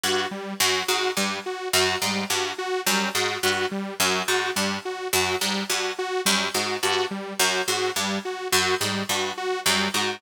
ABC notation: X:1
M:3/4
L:1/8
Q:1/4=106
K:none
V:1 name="Pizzicato Strings" clef=bass
G,, z _G,, _A,, =G,, z | _G,, _A,, =G,, z _G,, A,, | G,, z _G,, _A,, =G,, z | _G,, _A,, =G,, z _G,, A,, |
G,, z _G,, _A,, =G,, z | _G,, _A,, =G,, z _G,, A,, |]
V:2 name="Lead 2 (sawtooth)"
_G =G, _G G =G, _G | _G =G, _G G =G, _G | _G =G, _G G =G, _G | _G =G, _G G =G, _G |
_G =G, _G G =G, _G | _G =G, _G G =G, _G |]